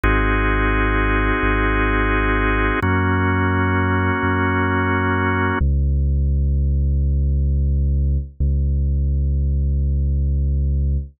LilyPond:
<<
  \new Staff \with { instrumentName = "Drawbar Organ" } { \time 4/4 \key des \major \tempo 4 = 86 <c' ees' ges' aes'>1 | <bes des' ges'>1 | r1 | r1 | }
  \new Staff \with { instrumentName = "Synth Bass 2" } { \clef bass \time 4/4 \key des \major aes,,2 aes,,2 | ges,2 ges,2 | des,1 | des,1 | }
>>